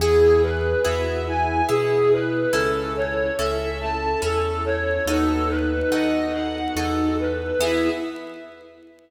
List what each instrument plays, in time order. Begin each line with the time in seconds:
0.00 acoustic grand piano E2, string ensemble 1 B3 E4 G#4, orchestral harp B3 E4 G#4, ocarina G#4, violin G#4
0.42 ocarina G#4, violin B4
0.84 acoustic grand piano E2, orchestral harp B3 E4 G#4, ocarina F#4, violin E5
1.25 ocarina E4, violin G#5
1.69 acoustic grand piano B2, orchestral harp B3 E4 G#4, ocarina E4, violin G#4
2.12 violin B4
2.53 acoustic grand piano C#2, orchestral harp C#4 E4 A4, string ensemble 1 C#4 E4 A4, violin A4, ocarina A4
2.96 violin C#5
3.38 acoustic grand piano C#2, orchestral harp C#4 E4 A4, violin E5
3.80 violin A5
4.22 acoustic grand piano E2, orchestral harp C#4 E4 A4, violin A4
4.65 violin C#5
5.06 acoustic grand piano D#2, string ensemble 1 B3 D#4 F#4 A4, orchestral harp B3 D#4 F#4 A4, ocarina D#4, violin A4
5.49 violin B4
5.91 acoustic grand piano D#2, orchestral harp B3 D#4 F#4 A4, violin D#5
6.33 ocarina D#4, violin F#5
6.76 acoustic grand piano E2, orchestral harp B3 D#4 F#4 A4, violin A4
7.19 violin B4
7.60 acoustic grand piano E2, orchestral harp B3 E4 G#4, string ensemble 1 B3 E4 G#4, ocarina E4, violin E5